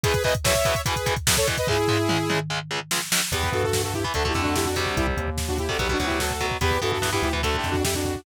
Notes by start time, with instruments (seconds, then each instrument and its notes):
0.04 overdriven guitar E2 B2 E3, lead 2 (sawtooth) G#4 B4, kick, closed hi-hat
0.14 kick, closed hi-hat
0.24 overdriven guitar E2 B2 E3, lead 2 (sawtooth) B4 D#5, kick, closed hi-hat
0.35 kick, closed hi-hat
0.44 overdriven guitar E2 B2 E3, lead 2 (sawtooth) C#5 E5, kick, snare
0.55 kick, closed hi-hat
0.65 overdriven guitar E2 B2 E3, kick, closed hi-hat
0.75 kick, closed hi-hat
0.86 overdriven guitar E2 B2 E3, lead 2 (sawtooth) G#4 B4, kick, closed hi-hat
0.96 kick, closed hi-hat
1.06 overdriven guitar E2 B2 E3, kick, closed hi-hat
1.16 kick, closed hi-hat
1.27 overdriven guitar E2 B2 E3, kick, snare
1.37 lead 2 (sawtooth) A4 C#5, kick, closed hi-hat
1.47 overdriven guitar E2 B2 E3, kick, closed hi-hat
1.57 lead 2 (sawtooth) B4 D#5, kick, closed hi-hat
1.67 overdriven guitar C#2 C#3 G#3, lead 2 (sawtooth) E4 G#4, kick, floor tom
1.88 overdriven guitar C#2 C#3 G#3, floor tom
2.09 overdriven guitar C#2 C#3 G#3, mid tom
2.30 overdriven guitar C#2 C#3 G#3, mid tom
2.50 overdriven guitar C#2 C#3 G#3
2.71 overdriven guitar C#2 C#3 G#3
2.91 overdriven guitar C#2 C#3 G#3, snare
3.12 overdriven guitar C#2 C#3 G#3, snare
3.32 synth bass 1 E2, overdriven guitar E3 B3, lead 2 (sawtooth) G4 B4, kick, closed hi-hat
3.43 kick
3.52 synth bass 1 G2, lead 2 (sawtooth) F#4 A4, kick, closed hi-hat
3.63 lead 2 (sawtooth) F#4 A4, kick
3.73 kick, snare
3.84 lead 2 (sawtooth) F#4 A4, kick
3.94 lead 2 (sawtooth) E4 G4, kick, closed hi-hat
4.04 overdriven guitar E3 B3, kick
4.14 synth bass 1 D2, overdriven guitar D3 A3, lead 2 (sawtooth) F#4 A4, kick, closed hi-hat
4.25 overdriven guitar D3 A3, lead 2 (sawtooth) E4 G4, kick
4.34 synth bass 1 F2, overdriven guitar D3 A3, kick, snare, closed hi-hat
4.42 lead 2 (sawtooth) D4 F#4, kick
4.56 lead 2 (sawtooth) E4 G4, kick, snare
4.65 lead 2 (sawtooth) D4 F#4, kick
4.76 overdriven guitar C3 G3, kick, open hi-hat
4.86 kick
4.97 synth bass 1 C2, lead 2 (sawtooth) E4 G4, kick, closed hi-hat
5.07 kick
5.17 synth bass 1 D#2, kick, closed hi-hat
5.28 kick
5.37 kick, snare
5.48 lead 2 (sawtooth) D4 F#4, kick
5.58 lead 2 (sawtooth) E4 G4, kick, closed hi-hat
5.69 overdriven guitar C3 G3, lead 2 (sawtooth) F#4 A4, kick
5.79 synth bass 1 B1, overdriven guitar B2 F#3, lead 2 (sawtooth) G4 B4, kick, closed hi-hat
5.89 overdriven guitar B2 F#3, lead 2 (sawtooth) D4 F#4, kick
5.99 synth bass 1 D2, overdriven guitar B2 F#3, kick, snare, closed hi-hat
6.06 lead 2 (sawtooth) E4 G4, kick
6.20 lead 2 (sawtooth) F#4 A4, kick, snare
6.31 kick
6.40 overdriven guitar B2 F#3, kick, closed hi-hat
6.51 kick
6.61 synth bass 1 E2, overdriven guitar E3 B3, lead 2 (sawtooth) G4 B4, kick, closed hi-hat
6.71 kick
6.82 synth bass 1 G2, overdriven guitar E3 B3, lead 2 (sawtooth) F#4 A4, kick, closed hi-hat
6.92 lead 2 (sawtooth) F#4 A4, kick
7.02 overdriven guitar E3 B3, kick, snare
7.13 overdriven guitar E3 B3, lead 2 (sawtooth) E4 G4, kick
7.22 synth bass 1 D2, lead 2 (sawtooth) E4 G4, kick, closed hi-hat
7.33 overdriven guitar E3 B3, kick
7.43 overdriven guitar D3 A3, lead 2 (sawtooth) F#4 A4, kick, closed hi-hat
7.54 lead 2 (sawtooth) E4 G4, kick
7.64 synth bass 1 F2, kick, snare, closed hi-hat
7.71 lead 2 (sawtooth) D4 F#4, kick
7.84 lead 2 (sawtooth) E4 G4, kick, snare
7.95 lead 2 (sawtooth) D4 F#4, kick
8.05 kick, closed hi-hat
8.15 kick